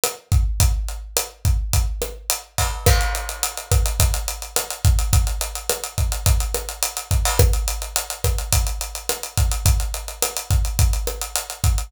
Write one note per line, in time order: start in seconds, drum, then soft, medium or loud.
0.04 cross-stick medium
0.04 closed hi-hat medium
0.32 kick medium
0.32 closed hi-hat medium
0.60 kick medium
0.60 closed hi-hat loud
0.88 closed hi-hat medium
1.17 cross-stick medium
1.17 closed hi-hat loud
1.45 kick medium
1.45 closed hi-hat medium
1.73 kick medium
1.73 closed hi-hat medium
2.02 cross-stick medium
2.02 closed hi-hat medium
2.30 closed hi-hat loud
2.58 kick medium
2.58 open hi-hat medium
2.86 kick medium
2.86 cross-stick loud
2.86 crash medium
3.01 closed hi-hat medium
3.15 closed hi-hat medium
3.29 closed hi-hat medium
3.43 closed hi-hat medium
3.57 closed hi-hat medium
3.72 kick medium
3.72 cross-stick medium
3.72 closed hi-hat medium
3.86 closed hi-hat medium
4.00 kick medium
4.00 closed hi-hat loud
4.14 closed hi-hat medium
4.28 closed hi-hat medium
4.42 closed hi-hat medium
4.56 cross-stick medium
4.56 closed hi-hat loud
4.71 closed hi-hat medium
4.85 kick medium
4.85 closed hi-hat medium
4.99 closed hi-hat medium
5.13 kick medium
5.13 closed hi-hat medium
5.27 closed hi-hat medium
5.41 closed hi-hat medium
5.55 closed hi-hat medium
5.69 cross-stick medium
5.69 closed hi-hat medium
5.84 closed hi-hat medium
5.98 kick medium
5.98 closed hi-hat medium
6.12 closed hi-hat medium
6.26 kick medium
6.26 closed hi-hat medium
6.40 closed hi-hat medium
6.54 cross-stick medium
6.54 closed hi-hat medium
6.69 closed hi-hat medium
6.83 closed hi-hat medium
6.97 closed hi-hat medium
7.11 kick medium
7.11 closed hi-hat medium
7.25 open hi-hat medium
7.39 kick medium
7.39 cross-stick loud
7.39 closed hi-hat medium
7.53 closed hi-hat medium
7.68 closed hi-hat medium
7.82 closed hi-hat medium
7.96 closed hi-hat medium
8.10 closed hi-hat medium
8.24 kick medium
8.24 cross-stick medium
8.24 closed hi-hat medium
8.38 closed hi-hat medium
8.53 kick medium
8.53 closed hi-hat loud
8.67 closed hi-hat medium
8.81 closed hi-hat medium
8.95 closed hi-hat medium
9.09 cross-stick medium
9.09 closed hi-hat medium
9.23 closed hi-hat medium
9.38 kick medium
9.38 closed hi-hat medium
9.52 closed hi-hat medium
9.66 kick medium
9.66 closed hi-hat medium
9.80 closed hi-hat medium
9.94 closed hi-hat medium
10.08 closed hi-hat medium
10.22 cross-stick medium
10.22 closed hi-hat loud
10.37 closed hi-hat medium
10.51 kick medium
10.51 closed hi-hat medium
10.65 closed hi-hat medium
10.79 kick medium
10.79 closed hi-hat medium
10.93 closed hi-hat medium
11.07 cross-stick medium
11.07 closed hi-hat medium
11.21 closed hi-hat medium
11.36 closed hi-hat medium
11.50 closed hi-hat medium
11.64 kick medium
11.64 closed hi-hat medium
11.78 closed hi-hat medium